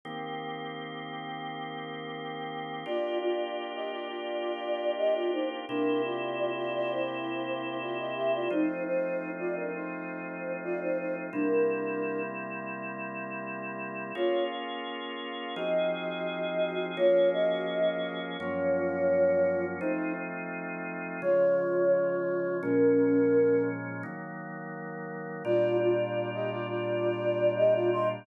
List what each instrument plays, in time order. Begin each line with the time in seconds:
0.05 drawbar organ D#3 A#3 C4 G4
2.86 drawbar organ A#3 D4 F4 G4, flute F4 D5
3.22 flute F4 D5
3.75 flute G4 D#5
3.92 flute F4 D5
4.08 flute F4 D5
4.97 flute G4 D#5
5.14 flute F4 D5
5.33 flute D#4 C5
5.69 drawbar organ C3 A#3 E4 G4, flute D4 A#4
6.04 flute F4 D5
6.56 flute F4 D5
6.75 flute F4 D5
6.91 flute E4 C5
7.81 flute F4 D5
7.98 flute D#5
8.15 flute G4 E5
8.34 flute F4 D5
8.50 drawbar organ F3 A3 C4 D#4, flute D#4 C5
8.86 flute D#4 C5
9.38 flute F4 D5
9.56 flute D4 A#4
9.74 flute D#4 C5
10.63 flute F4 D5
10.81 flute D#4 C5
10.99 flute D#4 C5
11.32 drawbar organ C3 G3 A#3 E4, flute D4 A#4
14.15 drawbar organ A#3 C#4 F4 G#4, flute F4 C#5
15.56 drawbar organ F3 C4 D#4 G#4, flute F#4 D#5
16.97 drawbar organ F3 A#3 C#4 G#4, flute F4 C#5
17.32 flute F#4 D#5
18.38 drawbar organ F#2 F3 A#3 C#4, flute F4 C#5
19.80 drawbar organ F3 A3 C4 D#4, flute D#4 C5
21.22 drawbar organ C#3 F3 G#3, flute F4 C#5
22.62 drawbar organ A#2 F3 G#3 C#4, flute C#4 A#4
24.03 drawbar organ D#3 F#3 A#3
25.45 drawbar organ A#2 G3 D4 F4, flute F4 D5
25.80 flute F4 D5
26.34 flute G4 D#5
26.51 flute F4 D5
26.69 flute F4 D5
27.57 flute G4 D#5
27.74 flute F4 D5
27.92 flute D#5 C6